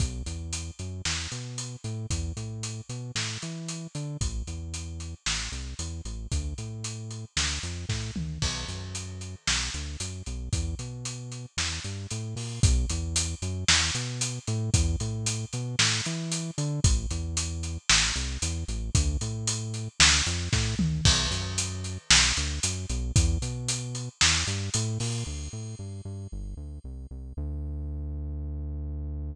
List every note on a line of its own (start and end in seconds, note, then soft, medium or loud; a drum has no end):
0.00 0.23 B1 loud
0.00 kick loud
0.00 closed hi-hat medium
0.26 0.71 E2 medium
0.26 closed hi-hat medium
0.53 closed hi-hat loud
0.79 1.02 F#2 medium
0.79 closed hi-hat medium
1.05 1.28 E2 medium
1.05 snare medium
1.32 1.76 B2 medium
1.32 closed hi-hat medium
1.58 closed hi-hat medium
1.84 2.07 A2 medium
1.84 closed hi-hat medium
2.10 2.33 E2 loud
2.10 kick medium
2.10 closed hi-hat medium
2.37 2.81 A2 medium
2.37 closed hi-hat medium
2.63 closed hi-hat medium
2.89 3.12 B2 medium
2.89 closed hi-hat medium
3.15 3.38 A2 medium
3.15 snare medium
3.42 3.87 E3 medium
3.42 closed hi-hat medium
3.68 closed hi-hat medium
3.95 4.17 D3 medium
3.95 closed hi-hat medium
4.21 4.43 A1 medium
4.21 kick medium
4.21 closed hi-hat medium
4.47 5.15 E2 medium
4.47 closed hi-hat medium
4.74 closed hi-hat medium
5.00 closed hi-hat medium
5.26 5.49 A1 medium
5.26 snare medium
5.52 5.74 C2 medium
5.52 closed hi-hat medium
5.79 6.01 E2 medium
5.79 closed hi-hat medium
6.05 6.27 A1 medium
6.05 closed hi-hat medium
6.32 6.54 D2 loud
6.32 kick medium
6.32 closed hi-hat medium
6.58 7.25 A2 medium
6.58 closed hi-hat medium
6.84 closed hi-hat medium
7.11 closed hi-hat medium
7.37 7.59 D2 medium
7.37 snare loud
7.63 7.86 F2 medium
7.63 closed hi-hat medium
7.89 8.11 A2 medium
7.89 kick medium
7.89 snare medium
8.16 8.39 D2 medium
8.16 mid tom medium
8.42 8.65 B1 medium
8.42 kick medium
8.42 crash medium
8.68 9.35 F#2 medium
8.68 closed hi-hat medium
8.95 closed hi-hat medium
9.21 closed hi-hat medium
9.47 9.70 B1 medium
9.47 snare loud
9.74 9.97 D2 medium
9.74 closed hi-hat medium
10.00 10.22 F#2 medium
10.00 closed hi-hat loud
10.26 10.49 B1 medium
10.26 closed hi-hat medium
10.53 10.75 E2 loud
10.53 kick medium
10.53 closed hi-hat medium
10.79 11.46 B2 medium
10.79 closed hi-hat medium
11.05 closed hi-hat medium
11.32 closed hi-hat medium
11.57 11.80 E2 medium
11.57 snare medium
11.57 closed hi-hat soft
11.84 12.07 G2 medium
11.84 closed hi-hat medium
12.11 12.35 A2 medium
12.11 closed hi-hat medium
12.36 12.60 A#2 medium
12.36 open hi-hat medium
12.63 12.86 B1 loud
12.63 kick loud
12.63 closed hi-hat loud
12.89 13.35 E2 loud
12.89 closed hi-hat loud
13.16 closed hi-hat loud
13.42 13.64 F#2 loud
13.42 closed hi-hat medium
13.68 13.91 E2 loud
13.68 snare loud
13.95 14.39 B2 medium
13.95 closed hi-hat medium
14.21 closed hi-hat loud
14.47 14.70 A2 loud
14.47 closed hi-hat medium
14.74 14.96 E2 loud
14.74 kick loud
14.74 closed hi-hat loud
15.00 15.45 A2 loud
15.00 closed hi-hat medium
15.26 closed hi-hat loud
15.53 15.76 B2 loud
15.53 closed hi-hat medium
15.79 16.01 A2 loud
15.79 snare loud
16.05 16.51 E3 loud
16.05 closed hi-hat medium
16.32 closed hi-hat loud
16.58 16.80 D3 loud
16.58 closed hi-hat medium
16.84 17.06 A1 loud
16.84 kick loud
16.84 closed hi-hat loud
17.11 17.78 E2 loud
17.11 closed hi-hat medium
17.37 closed hi-hat loud
17.63 closed hi-hat medium
17.89 18.12 A1 loud
17.89 snare loud
18.16 18.38 C2 loud
18.16 closed hi-hat medium
18.42 18.64 E2 loud
18.42 closed hi-hat loud
18.68 18.91 A1 loud
18.68 closed hi-hat medium
18.95 19.17 D2 loud
18.95 kick loud
18.95 closed hi-hat loud
19.21 19.88 A2 loud
19.21 closed hi-hat medium
19.47 closed hi-hat loud
19.74 closed hi-hat medium
20.00 20.22 D2 loud
20.00 snare loud
20.26 20.49 F2 loud
20.26 closed hi-hat medium
20.53 20.75 A2 loud
20.53 kick loud
20.53 snare medium
20.79 21.01 D2 medium
20.79 mid tom loud
21.05 21.28 B1 loud
21.05 kick loud
21.05 crash loud
21.31 21.98 F#2 medium
21.31 closed hi-hat medium
21.58 closed hi-hat loud
21.84 closed hi-hat medium
22.11 22.33 B1 loud
22.11 snare loud
22.37 22.60 D2 loud
22.37 closed hi-hat medium
22.63 22.86 F#2 medium
22.63 closed hi-hat loud
22.89 23.12 B1 loud
22.89 closed hi-hat medium
23.16 23.38 E2 loud
23.16 kick loud
23.16 closed hi-hat loud
23.42 24.09 B2 medium
23.42 closed hi-hat medium
23.68 closed hi-hat loud
23.95 closed hi-hat medium
24.21 24.44 E2 loud
24.21 snare loud
24.21 closed hi-hat medium
24.47 24.70 G2 loud
24.47 closed hi-hat medium
24.74 24.98 A2 loud
24.74 closed hi-hat loud
25.00 25.24 A#2 loud
25.00 open hi-hat medium
25.26 25.49 D2 medium
25.53 25.75 A2 medium
25.79 26.01 G2 medium
26.05 26.28 G2 medium
26.32 26.55 G1 medium
26.57 26.79 D2 medium
26.84 27.07 C2 medium
27.11 27.33 C2 medium
27.37 29.35 D2 loud